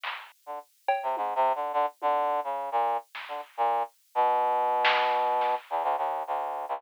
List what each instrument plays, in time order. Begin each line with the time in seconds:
0.04 clap
0.46 brass section D3
0.88 cowbell
1.03 brass section C3
1.17 brass section G#2, high tom
1.35 brass section C3
1.55 brass section D3
1.73 brass section D3
2.02 brass section D3, high tom
2.30 floor tom
2.44 brass section C#3
2.72 brass section A#2
3.15 snare
3.28 brass section D3
3.57 brass section A#2
4.15 brass section B2
4.85 snare
5.13 kick
5.41 snare
5.70 brass section E2
5.83 brass section D2
5.98 brass section D#2
6.27 brass section D2
6.69 brass section C#2